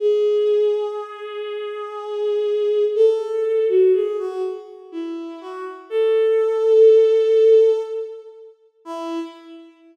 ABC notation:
X:1
M:3/4
L:1/16
Q:1/4=61
K:E
V:1 name="Violin"
G12 | A3 F G F z2 E2 F z | A8 z4 | E4 z8 |]